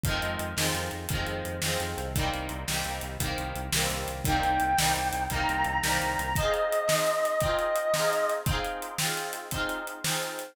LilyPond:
<<
  \new Staff \with { instrumentName = "Lead 1 (square)" } { \time 12/8 \key c \minor \tempo 4. = 114 r1. | r1. | g''2. bes''2. | ees''1. |
r1. | }
  \new Staff \with { instrumentName = "Overdriven Guitar" } { \time 12/8 \key c \minor <ees f aes c'>4. <ees f aes c'>4. <ees f aes c'>4. <ees f aes c'>4. | <ees g bes c'>4. <ees g bes c'>4. <ees g bes c'>4. <ees g bes c'>4. | <ees g bes c'>4. <ees g bes c'>4. <ees g bes c'>4. <ees g bes c'>4. | <c' ees' f' aes'>4. <c' ees' f' aes'>4. <c' ees' f' aes'>4. <c' ees' f' aes'>4. |
<c' ees' f' aes'>4. <c' ees' f' aes'>4. <c' ees' f' aes'>4. <c' ees' f' aes'>4. | }
  \new Staff \with { instrumentName = "Synth Bass 1" } { \clef bass \time 12/8 \key c \minor f,8 f,8 f,8 f,8 f,8 f,8 f,8 f,8 f,8 f,8 f,8 c,8~ | c,8 c,8 c,8 c,8 c,8 c,8 c,8 c,8 c,8 c,8 c,8 c,8 | c,8 c,8 c,8 c,8 c,8 c,8 c,8 c,8 c,8 c,8 c,8 c,8 | r1. |
r1. | }
  \new DrumStaff \with { instrumentName = "Drums" } \drummode { \time 12/8 <hh bd>8 hh8 hh8 sn8 hh8 hh8 <hh bd>8 hh8 hh8 sn8 hh8 hh8 | <hh bd>8 hh8 hh8 sn8 hh8 hh8 <hh bd>8 hh8 hh8 sn8 hh8 hh8 | <hh bd>8 hh8 hh8 sn8 hh8 hh8 <hh bd>8 hh8 hh8 sn8 hh8 hh8 | <hh bd>8 hh8 hh8 sn8 hh8 hh8 <hh bd>8 hh8 hh8 sn8 hh8 hh8 |
<hh bd>8 hh8 hh8 sn8 hh8 hh8 <hh bd>8 hh8 hh8 sn8 hh8 hh8 | }
>>